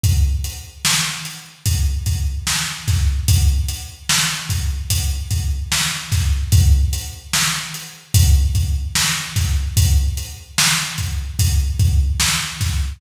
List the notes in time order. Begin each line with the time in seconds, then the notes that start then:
0.04 kick, closed hi-hat
0.44 closed hi-hat
0.85 snare
1.25 closed hi-hat
1.66 kick, closed hi-hat
2.06 kick, closed hi-hat
2.47 snare
2.88 kick, snare, closed hi-hat
3.28 kick, closed hi-hat
3.68 closed hi-hat
4.09 snare
4.49 kick, closed hi-hat
4.90 kick, closed hi-hat
5.31 kick, closed hi-hat
5.72 snare
6.12 kick, snare, closed hi-hat
6.52 kick, closed hi-hat
6.93 closed hi-hat
7.33 snare
7.74 closed hi-hat
8.14 kick, closed hi-hat
8.55 kick, closed hi-hat
8.95 snare
9.36 kick, snare, closed hi-hat
9.77 kick, closed hi-hat
10.17 closed hi-hat
10.58 snare
10.98 kick, closed hi-hat
11.39 kick, closed hi-hat
11.79 kick, closed hi-hat
12.20 snare
12.61 kick, snare, closed hi-hat